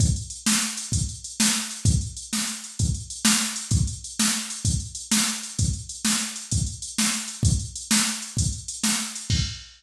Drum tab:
CC |------------|------------|------------|------------|
HH |xxx-xxxxx-xx|xxx-xxxxx-xx|xxx-xxxxx-xx|xxx-xxxxx-xx|
SD |---o-----o--|---o-----o--|---o-----o--|---o-----o--|
BD |o-----o-----|o-----o-----|o-----o-----|o-----o-----|

CC |------------|x-----------|
HH |xxx-xxxxx-xx|------------|
SD |---o-----o--|------------|
BD |o-----o-----|o-----------|